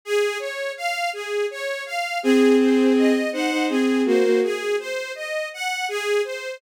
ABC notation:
X:1
M:3/4
L:1/16
Q:1/4=82
K:Db
V:1 name="Violin"
z12 | [CA]6 [Ec] [Ec] [CA]2 [B,G] [B,G] | z12 |]
V:2 name="String Ensemble 1"
A2 d2 f2 A2 d2 f2 | A2 c2 e2 g2 A2 c2 | A2 c2 e2 g2 A2 c2 |]